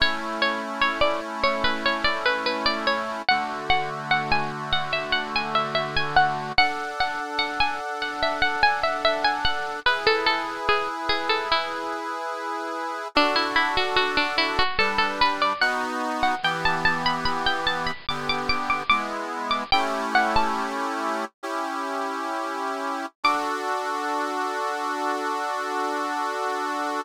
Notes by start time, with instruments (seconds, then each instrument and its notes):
0.00 accordion A3 C#4 E4, harpsichord C#5
0.42 harpsichord C#5
0.82 harpsichord C#5
1.01 harpsichord D5
1.43 harpsichord C#5
1.64 harpsichord B4
1.86 harpsichord C#5
2.04 harpsichord D5
2.26 harpsichord B4
2.46 harpsichord B4
2.66 harpsichord D5
2.87 harpsichord C#5
3.29 accordion D3 A3 F#4, harpsichord F#5
3.70 harpsichord F#5
4.11 harpsichord F#5
4.32 harpsichord G#5
4.73 harpsichord F#5
4.93 harpsichord E5
5.12 harpsichord F#5
5.36 harpsichord G#5
5.55 harpsichord E5
5.75 harpsichord E5
5.97 harpsichord G#5
6.16 harpsichord F#5
6.58 accordion D4 A4 F#5, harpsichord F#5
7.00 harpsichord F#5
7.39 harpsichord F#5
7.60 harpsichord G#5
8.02 harpsichord F#5
8.23 harpsichord E5
8.42 harpsichord F#5
8.63 harpsichord G#5
8.83 harpsichord E5
9.05 harpsichord E5
9.24 harpsichord G#5
9.45 harpsichord F#5
9.86 accordion E4 G#4 B4, harpsichord B4
10.07 harpsichord A4
10.26 harpsichord A4
10.69 harpsichord G#4
11.09 harpsichord G#4
11.29 harpsichord A4
11.52 harpsichord E4
13.15 accordion D4 F#4 A4, harpsichord D4
13.36 harpsichord E4
13.56 harpsichord E4
13.77 harpsichord F#4
13.96 harpsichord F#4
14.17 harpsichord D4
14.38 harpsichord E4
14.59 harpsichord F#4
14.79 accordion G3 D4 B4, harpsichord A4
14.98 harpsichord A4
15.21 harpsichord B4
15.42 harpsichord D5
15.61 accordion B3 D#4 F#4, harpsichord F#5
16.23 harpsichord F#5
16.43 accordion E3 B3 G4, harpsichord G5
16.65 harpsichord A5
16.85 harpsichord A5
17.06 harpsichord B5
17.25 harpsichord B5
17.46 harpsichord G5
17.67 harpsichord A5
17.86 harpsichord B5
18.09 accordion D3 B3 G4, harpsichord D6
18.29 harpsichord D6
18.49 harpsichord D6
18.70 harpsichord D6
18.90 accordion G#3 B3 E4, harpsichord D6
19.51 harpsichord D6
19.72 accordion A3 C#4 E4 G4, harpsichord G5
20.15 harpsichord F#5
20.36 harpsichord A5
21.43 accordion C#4 E4 G4
23.24 accordion D4 F#4 A4, harpsichord D6